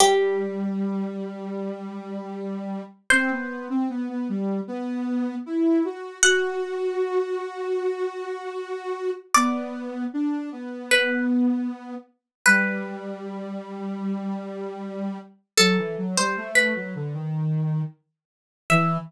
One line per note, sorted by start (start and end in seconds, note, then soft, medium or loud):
0.00 2.82 G3 medium
0.00 2.50 G4 loud
3.10 3.30 C4 medium
3.10 6.03 C5 loud
3.31 3.68 B3 medium
3.70 3.88 C4 medium
3.90 4.08 B3 medium
4.09 4.28 B3 medium
4.29 4.61 G3 medium
4.68 5.35 B3 medium
5.46 5.83 E4 medium
5.85 6.18 F#4 medium
6.23 9.11 F#4 medium
6.23 8.88 F#5 loud
9.34 10.05 B3 medium
9.34 10.62 D5 loud
10.13 10.50 D4 medium
10.52 11.95 B3 medium
10.91 11.25 B4 loud
12.46 15.18 G3 medium
12.46 15.40 B4 loud
15.57 15.77 F#3 medium
15.57 16.06 A4 loud
15.78 15.96 E3 medium
15.98 16.16 F#3 medium
16.17 16.36 G3 medium
16.17 16.49 C5 loud
16.37 16.74 A3 medium
16.55 17.43 B4 loud
16.75 16.94 F#3 medium
16.95 17.14 D3 medium
17.14 17.82 D#3 medium
18.70 18.97 E3 loud
18.70 18.97 E5 loud